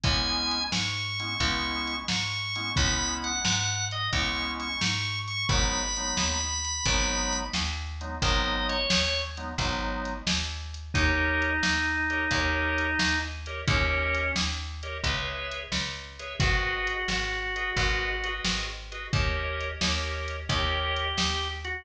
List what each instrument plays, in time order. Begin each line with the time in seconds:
0.04 electric bass (finger) C#2, drawbar organ G#3 B3 C#4 E4 G#5, kick, closed hi-hat
0.51 closed hi-hat
0.72 electric bass (finger) G#2, drawbar organ C#6, snare
1.20 drawbar organ G#3 B3 C#4 E4, closed hi-hat
1.40 electric bass (finger) C#2, drawbar organ G#3 B3 C#4 E4, kick, closed hi-hat
1.87 closed hi-hat
2.08 electric bass (finger) G#2, drawbar organ C#6, snare
2.55 drawbar organ G#3 B3 C#4 E4, closed hi-hat
2.76 electric bass (finger) C#2, drawbar organ G#3 B3 C#4 E4 B5, kick, closed hi-hat
3.24 drawbar organ F#5, closed hi-hat
3.45 electric bass (finger) G#2, snare
3.91 drawbar organ D#5, closed hi-hat
4.13 electric bass (finger) C#2, drawbar organ G#3 B3 C#4 E4 C#6, kick, closed hi-hat
4.60 drawbar organ C#6, closed hi-hat
4.81 electric bass (finger) G#2, snare
5.28 drawbar organ C#6, closed hi-hat
5.49 electric bass (finger) G#1, drawbar organ F#3 G#3 B3 D#4 B5, kick, closed hi-hat
5.97 drawbar organ F#3 G#3 B3 D#4, closed hi-hat
6.17 electric bass (finger) D#2, snare
6.65 closed hi-hat
6.86 electric bass (finger) G#1, drawbar organ F#3 G#3 B3 D#4, kick, closed hi-hat
7.33 closed hi-hat
7.54 electric bass (finger) D#2, snare
8.01 drawbar organ F#3 G#3 B3 D#4, closed hi-hat
8.22 electric bass (finger) G#1, drawbar organ F#3 G#3 B3 D#4 D#5, kick, closed hi-hat
8.69 drawbar organ C#5, closed hi-hat
8.90 electric bass (finger) D#2, snare
9.37 drawbar organ F#3 G#3 B3 D#4, closed hi-hat
9.58 electric bass (finger) G#1, drawbar organ F#3 G#3 B3 D#4, kick, closed hi-hat
10.05 closed hi-hat
10.27 electric bass (finger) D#2, snare
10.74 closed hi-hat
10.94 electric bass (finger) D#2, drawbar organ D#4 G4 A#4 C#5 D#5, kick, closed hi-hat
11.42 closed hi-hat
11.63 electric bass (finger) D#2, snare
12.10 drawbar organ G4 A#4 C#5 D#5, closed hi-hat
12.31 electric bass (finger) D#2, drawbar organ G4 A#4 C#5 D#5, kick, closed hi-hat
12.78 closed hi-hat
12.99 electric bass (finger) D#2, snare
13.46 drawbar organ G4 A#4 C#5 D#5, closed hi-hat
13.67 electric bass (finger) D#2, drawbar organ C#4 G4 A#4 C#5 D#5, kick, closed hi-hat
14.14 closed hi-hat
14.36 electric bass (finger) D#2, snare
14.83 drawbar organ G4 A#4 C#5 D#5, closed hi-hat
15.04 electric bass (finger) C#2, drawbar organ G#4 B4 C#5 E5, kick, closed hi-hat
15.52 closed hi-hat
15.72 electric bass (finger) C#2, snare
16.19 drawbar organ G#4 B4 C#5 E5, closed hi-hat
16.39 electric bass (finger) G#1, drawbar organ F#4 G#4 B4 D#5, kick, closed hi-hat
16.87 closed hi-hat
17.08 electric bass (finger) G#1, snare
17.56 drawbar organ F#4 G#4 B4 D#5, closed hi-hat
17.77 electric bass (finger) G#1, drawbar organ F#4 G#4 B4 D#5, kick, closed hi-hat
18.24 drawbar organ F#4 G#4 B4 D#5, closed hi-hat
18.45 electric bass (finger) G#1, snare
18.92 drawbar organ F#4 G#4 B4 D#5, closed hi-hat
19.13 electric bass (finger) D#2, drawbar organ G4 A#4 C#5 D#5, kick, closed hi-hat
19.61 closed hi-hat
19.81 electric bass (finger) D#2, drawbar organ G4 A#4 C#5 D#5, snare
20.28 closed hi-hat
20.49 electric bass (finger) D#2, drawbar organ G4 A#4 C#5 D#5, kick, closed hi-hat
20.96 closed hi-hat
21.17 electric bass (finger) D#2, snare
21.65 drawbar organ F#4, closed hi-hat